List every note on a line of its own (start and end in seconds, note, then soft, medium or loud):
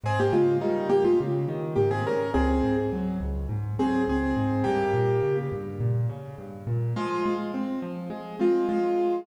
0.03 0.29 G#2 loud
0.03 0.19 C4 medium
0.03 0.19 G#4 medium
0.20 0.33 A#3 medium
0.20 0.33 G4 medium
0.32 0.58 C#3 medium
0.32 0.57 G#3 medium
0.32 0.57 F4 medium
0.61 0.87 D#3 medium
0.61 0.88 G3 medium
0.61 0.88 D#4 medium
0.89 1.15 G#2 medium
0.89 1.03 A#3 medium
0.89 1.03 G4 medium
1.04 1.18 G#3 medium
1.04 1.18 F4 medium
1.20 1.46 C#3 medium
1.48 1.74 D#3 loud
1.75 2.03 G#2 medium
1.75 1.89 A#3 medium
1.75 1.89 G4 medium
1.91 2.04 C4 medium
1.91 2.04 G#4 medium
2.06 2.32 C#3 medium
2.06 2.30 C#4 medium
2.06 2.30 A#4 medium
2.34 2.61 C#2 loud
2.34 2.76 C4 medium
2.34 2.76 G#4 medium
2.63 2.89 G#2 medium
2.92 3.18 F#3 medium
3.20 3.46 C#2 medium
3.49 3.75 G#2 medium
3.79 4.05 F#3 medium
3.79 4.02 C4 medium
3.79 4.02 G#4 medium
4.07 4.33 C#2 medium
4.07 4.64 C4 medium
4.07 4.64 G#4 medium
4.36 4.62 G#2 medium
4.64 4.92 G2 loud
4.64 5.36 A#3 medium
4.64 5.36 G4 medium
4.94 5.19 A#2 medium
5.23 5.49 C#3 medium
5.52 5.78 G2 medium
5.80 6.06 A#2 medium
6.09 6.35 C#3 medium
6.38 6.64 G2 medium
6.67 6.93 A#2 medium
6.96 7.23 F3 loud
6.96 7.33 G#3 medium
6.96 7.33 F4 medium
7.26 7.52 G#3 loud
7.54 7.80 C4 medium
7.82 8.08 F3 medium
8.10 8.36 G#3 loud
8.39 8.67 G#3 medium
8.39 8.65 C4 medium
8.39 8.67 F4 medium
8.69 8.95 F3 medium
8.69 9.20 G#3 medium
8.69 9.20 F4 medium
8.99 9.25 G#3 medium